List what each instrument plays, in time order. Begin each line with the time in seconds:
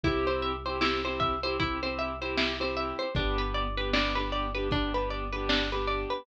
0.03 synth bass 2 C2, acoustic grand piano C4 E4 G4, pizzicato strings E4, kick, closed hi-hat
0.27 pizzicato strings C5
0.42 pizzicato strings E5, closed hi-hat
0.65 acoustic grand piano C4 E4 G4, pizzicato strings C5
0.81 acoustic grand piano C4 E4 G4, pizzicato strings E4, snare
1.05 acoustic grand piano C4 E4 G4, pizzicato strings C5
1.20 pizzicato strings E5, kick, closed hi-hat
1.43 acoustic grand piano C4 E4 G4, pizzicato strings C5
1.59 acoustic grand piano C4 E4 G4, pizzicato strings E4, kick, closed hi-hat
1.82 acoustic grand piano C4 E4 G4, pizzicato strings C5
1.99 pizzicato strings E5, closed hi-hat
2.21 acoustic grand piano C4 E4 G4, pizzicato strings C5
2.37 pizzicato strings E4, snare
2.60 acoustic grand piano C4 E4 G4, pizzicato strings C5
2.77 pizzicato strings E5, closed hi-hat
2.99 pizzicato strings C5
3.15 synth bass 2 G1, acoustic grand piano B3 D4 G4, pizzicato strings D4, kick, closed hi-hat
3.38 pizzicato strings B4
3.54 pizzicato strings D5, closed hi-hat
3.77 acoustic grand piano B3 D4 G4, pizzicato strings B4
3.93 acoustic grand piano B3 D4 G4, pizzicato strings D4, snare
4.15 acoustic grand piano B3 D4 G4, pizzicato strings B4
4.32 pizzicato strings D5, closed hi-hat
4.55 acoustic grand piano B3 D4 G4, pizzicato strings B4
4.71 acoustic grand piano B3 D4 G4, pizzicato strings D4, kick, closed hi-hat
4.94 acoustic grand piano B3 D4 G4, pizzicato strings B4
5.10 pizzicato strings D5, closed hi-hat
5.32 acoustic grand piano B3 D4 G4, pizzicato strings B4
5.49 pizzicato strings D4, snare
5.72 acoustic grand piano B3 D4 G4, pizzicato strings B4
5.87 pizzicato strings D5, closed hi-hat
6.10 pizzicato strings B4